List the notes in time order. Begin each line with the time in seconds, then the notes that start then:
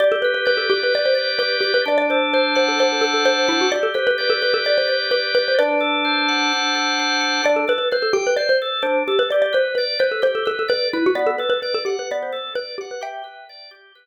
0.00 G4 D5
0.12 A4
0.22 B4
0.34 B4
0.45 B4 D5
0.57 A4
0.70 G4
0.83 B4
0.94 B4 D5
1.06 C5
1.15 D5
1.39 G4 B4
1.61 G4 B4
1.74 B4
1.86 D4 D5
1.98 D5
2.10 A4 C5
2.33 C5
2.55 C5 F#5
2.68 A4
2.79 D4 C5
2.92 A4
3.01 A4
3.14 A4
3.25 C5
3.48 E4 F#5
3.61 F#4
3.72 G4 D5
3.83 A4
3.94 B4 C5
4.07 B4
4.18 B4 D5
4.30 A4
4.42 G4 B4
4.54 A4
4.65 B4 D5
4.78 C5
4.88 D5
5.11 G4 B4
5.35 B4
5.48 C5
5.59 D4 B4 D5
5.81 A4
6.05 C5
6.28 F#5
6.53 D4
6.75 A4
6.99 C5
7.21 F#5
7.44 D4 D5
7.56 A4
7.68 A4 B4
7.78 B4
7.91 B4 C5
8.02 A4
8.13 G4 G5
8.27 B4
8.36 C5 D5
8.49 C5
8.62 A4
8.82 D4 C5
9.08 G4 A4
9.19 B4
9.30 G4 D5
9.42 D5
9.53 B4 C5
9.75 B4 D5
9.99 B4 C5
10.12 A4
10.22 G4 C5
10.35 A4
10.45 A4 B4
10.59 A4
10.68 B4 D5
10.93 E4 B4
11.06 F#4
11.15 B3 D5
11.27 A4
11.38 A4 B4
11.50 B4
11.62 B4 D5
11.74 A4
11.85 G4 F#5
11.99 B4
12.11 B3 D5
12.23 C5
12.32 A4
12.55 B4 D5
12.78 G4 F#5
12.91 B4
13.01 G4 E5 G5
13.24 B4
13.49 D5
13.71 G4
13.95 B4